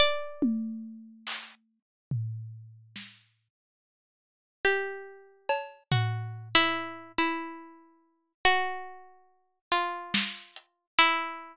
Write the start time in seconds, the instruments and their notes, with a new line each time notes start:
0.00 harpsichord D5
0.42 high tom
1.27 clap
2.11 floor tom
2.96 snare
4.65 harpsichord G4
5.49 cowbell
5.92 harpsichord F#4, floor tom
6.55 harpsichord E4
7.18 harpsichord E4
8.45 harpsichord F#4
9.72 harpsichord F4, closed hi-hat
10.14 snare
10.56 closed hi-hat
10.99 harpsichord E4